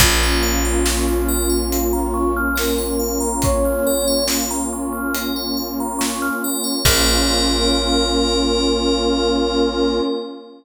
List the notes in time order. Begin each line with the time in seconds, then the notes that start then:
0.00 A#1 A#3 C#4 F4 A#4, kick, closed hi-hat
0.23 C#5
0.43 F5
0.65 A#5
0.85 C#6, snare
1.08 F6
1.28 A#4
1.49 C#5
1.72 F5, closed hi-hat
1.93 A#5
2.14 C#6
2.37 F6
2.56 A#4, snare
2.78 C#5
2.99 F5
3.20 A#5
3.42 C#5 C#6, kick, closed hi-hat
3.65 F6
3.87 A#4
4.08 C#5
4.28 F5, snare
4.51 A#5
4.73 C#6
4.93 F6
5.14 A#4, closed hi-hat
5.36 C#5
5.57 F5
5.80 A#5
5.99 C#6, snare
6.22 F6
6.44 A#4
6.64 C#5
6.85 A#1 A#3 C#4 F4 A#4 C#5 F5, kick, crash